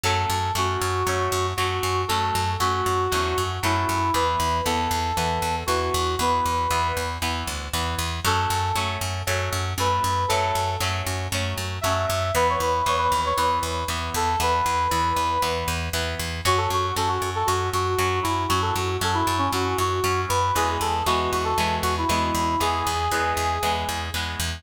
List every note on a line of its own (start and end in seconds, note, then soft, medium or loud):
0.03 0.25 F#2 medium
0.03 0.50 F#3 loud
0.03 0.50 A3 loud
0.03 0.50 C#4 medium
0.03 0.52 A4 medium
0.30 0.51 F#2 medium
0.55 0.77 F#2 medium
0.55 1.01 F#3 medium
0.55 1.01 A3 medium
0.55 1.01 C#4 medium
0.55 1.46 F#4 medium
0.82 1.03 F#2 medium
1.07 1.28 F#2 medium
1.07 1.53 F#3 medium
1.07 1.53 A3 medium
1.07 1.53 C#4 medium
1.32 1.54 F#2 medium
1.56 1.80 F#2 medium
1.56 2.04 F#3 medium
1.56 2.04 A3 medium
1.56 2.04 C#4 medium
1.56 2.02 F#4 medium
1.83 2.05 F#2 medium
2.08 2.31 F#2 medium
2.08 2.55 F#3 medium
2.08 2.55 A3 medium
2.08 2.55 C#4 medium
2.08 2.51 A4 medium
2.35 2.57 F#2 medium
2.60 2.82 F#2 medium
2.60 3.07 F#3 medium
2.60 3.07 A3 medium
2.60 3.07 C#4 medium
2.60 3.43 F#4 medium
2.86 3.08 F#2 medium
3.12 3.34 E2 medium
3.12 3.58 F#3 medium
3.12 3.58 A3 medium
3.12 3.58 C#4 medium
3.38 3.60 F#2 medium
3.63 3.85 F#2 medium
3.63 4.09 F#3 medium
3.63 4.09 A3 loud
3.63 4.09 C#4 medium
3.63 4.12 E4 medium
3.89 4.11 F#2 medium
4.14 4.36 E2 medium
4.14 4.60 E3 loud
4.14 4.60 B3 loud
4.14 4.58 B4 medium
4.40 4.61 E2 medium
4.65 4.88 E2 medium
4.65 5.12 E3 medium
4.65 5.12 B3 medium
4.65 5.55 A4 medium
4.91 5.13 E2 medium
5.17 5.39 E2 medium
5.17 5.63 E3 medium
5.17 5.63 B3 medium
5.42 5.64 E2 medium
5.66 5.90 E2 medium
5.66 6.14 E3 medium
5.66 6.14 B3 medium
5.66 6.15 F#4 medium
5.94 6.16 E2 medium
6.19 6.41 E2 medium
6.19 6.65 E3 medium
6.19 6.65 B3 medium
6.19 6.87 B4 medium
6.46 6.67 E2 medium
6.71 6.92 E2 medium
6.71 7.17 E3 medium
6.71 7.17 B3 medium
6.97 7.18 E2 medium
7.22 7.44 E2 medium
7.22 7.68 E3 medium
7.22 7.68 B3 medium
7.47 7.69 D2 medium
7.73 7.95 E2 medium
7.73 8.19 E3 medium
7.73 8.19 B3 loud
7.99 8.20 E2 medium
8.24 8.46 F#2 medium
8.24 8.71 F#3 loud
8.24 8.71 A3 loud
8.24 8.71 C#4 medium
8.24 8.75 A4 medium
8.50 8.72 F#2 medium
8.75 8.97 F#2 medium
8.75 9.22 F#3 medium
8.75 9.22 A3 loud
8.75 9.22 C#4 medium
9.01 9.23 F#2 medium
9.27 9.49 F#2 medium
9.27 9.73 F#3 medium
9.27 9.73 A3 medium
9.27 9.73 C#4 medium
9.53 9.74 F#2 medium
9.78 9.99 F#2 medium
9.78 10.25 F#3 medium
9.78 10.25 A3 medium
9.78 10.25 C#4 medium
9.78 10.24 B4 medium
10.04 10.26 F#2 medium
10.28 10.52 F#2 medium
10.28 10.76 F#3 loud
10.28 10.76 A3 medium
10.28 10.76 C#4 medium
10.28 10.70 A4 medium
10.55 10.77 F#2 medium
10.80 11.02 F#2 medium
10.80 11.27 F#3 medium
10.80 11.27 A3 medium
10.80 11.27 C#4 medium
11.07 11.28 F#2 medium
11.32 11.54 F#2 medium
11.32 11.78 F#3 medium
11.32 11.78 A3 medium
11.32 11.78 C#4 medium
11.57 11.79 F#2 medium
11.81 12.06 F#2 medium
11.81 12.30 F#3 medium
11.81 12.30 A3 medium
11.81 12.31 E5 medium
11.86 12.30 C#4 medium
12.10 12.31 F#2 medium
12.35 12.56 E2 medium
12.35 12.81 E3 loud
12.35 12.81 B3 loud
12.35 12.47 B4 loud
12.49 12.62 C#5 medium
12.60 12.82 E2 medium
12.60 12.84 B4 medium
12.86 13.08 E2 medium
12.86 13.32 E3 medium
12.86 13.32 B3 medium
12.86 12.99 C#5 medium
12.97 13.20 B4 medium
13.12 13.34 D#2 medium
13.25 13.38 C#5 medium
13.37 13.59 E2 medium
13.37 13.84 E3 medium
13.37 13.84 B3 medium
13.37 13.58 B4 medium
13.63 13.85 E2 medium
13.88 14.10 E2 medium
13.88 14.35 E3 medium
13.88 14.35 B3 medium
14.14 14.36 E2 medium
14.14 14.38 A4 medium
14.40 14.62 E2 medium
14.40 14.86 E3 medium
14.40 14.86 B3 medium
14.40 15.42 B4 medium
14.66 14.88 E2 medium
14.91 15.13 E2 medium
14.91 15.37 E3 medium
14.91 15.37 B3 medium
15.16 15.38 E2 medium
15.42 15.64 E2 medium
15.42 15.88 E3 medium
15.42 15.88 B3 medium
15.68 15.90 E2 medium
15.93 16.15 E2 medium
15.93 16.40 E3 loud
15.93 16.40 B3 medium
16.19 16.41 E2 medium
16.45 16.67 F#2 medium
16.45 16.91 F#3 loud
16.45 16.91 C#4 medium
16.45 16.58 F#4 loud
16.57 16.69 A4 medium
16.70 16.92 F#2 medium
16.70 16.94 F#4 medium
16.96 17.18 F#2 medium
16.96 17.42 F#3 medium
16.96 17.42 C#4 medium
16.96 17.09 A4 medium
17.07 17.30 F#4 medium
17.22 17.43 F#2 medium
17.35 17.47 A4 medium
17.46 17.70 F#2 medium
17.46 17.94 F#3 medium
17.46 17.94 C#4 medium
17.46 17.70 F#4 medium
17.73 17.95 F#2 medium
17.73 18.19 F#4 medium
17.99 18.20 F#2 medium
17.99 18.45 F#3 medium
17.99 18.45 C#4 medium
18.23 18.47 F#2 medium
18.23 18.43 E4 medium
18.49 18.72 F#2 medium
18.49 18.96 F#3 medium
18.49 18.96 C#4 medium
18.49 18.61 F#4 medium
18.61 18.74 A4 medium
18.76 18.97 F#2 medium
18.76 18.97 F#4 medium
19.01 19.23 F#2 medium
19.01 19.48 F#3 medium
19.01 19.48 C#4 medium
19.01 19.15 A4 medium
19.14 19.37 E4 medium
19.27 19.49 F#2 medium
19.38 19.50 C#4 medium
19.52 19.74 F#2 medium
19.52 19.99 F#3 medium
19.52 19.99 C#4 medium
19.52 19.77 F#4 medium
19.78 20.00 F#2 medium
19.78 20.21 F#4 medium
20.04 20.26 F#2 medium
20.04 20.50 F#3 medium
20.04 20.50 C#4 medium
20.29 20.52 F#2 medium
20.29 20.54 B4 medium
20.55 20.78 E2 medium
20.55 21.01 E3 loud
20.55 21.01 G#3 medium
20.55 21.01 B3 medium
20.55 20.68 G#4 loud
20.81 21.03 E2 medium
20.81 21.04 A4 medium
21.06 21.28 E2 medium
21.06 21.53 E3 medium
21.06 21.53 G#3 medium
21.06 21.53 B3 medium
21.06 21.31 F#4 medium
21.32 21.54 E2 medium
21.32 21.44 F#4 medium
21.44 21.75 A4 medium
21.58 21.79 E2 medium
21.58 22.04 E3 medium
21.58 22.04 G#3 medium
21.58 22.04 B3 medium
21.82 22.05 E2 medium
21.82 21.95 F#4 medium
21.98 22.10 E4 medium
22.09 22.31 E2 medium
22.09 22.55 E3 medium
22.09 22.55 G#3 medium
22.09 22.55 B3 medium
22.09 22.55 E4 medium
22.35 22.56 E2 medium
22.60 22.83 E2 medium
22.60 23.06 E3 medium
22.60 23.06 G#3 medium
22.60 23.06 B3 medium
22.60 23.70 G#4 medium
22.87 23.08 E2 medium
23.11 23.33 E2 medium
23.11 23.58 E3 medium
23.11 23.58 G#3 medium
23.11 23.58 B3 medium
23.37 23.59 E2 medium
23.63 23.85 E2 medium
23.63 24.09 E3 medium
23.63 24.09 G#3 medium
23.63 24.09 B3 medium
23.89 24.10 E2 medium
24.14 24.36 E2 medium
24.14 24.60 E3 medium
24.14 24.60 G#3 medium
24.14 24.60 B3 medium
24.40 24.61 E2 medium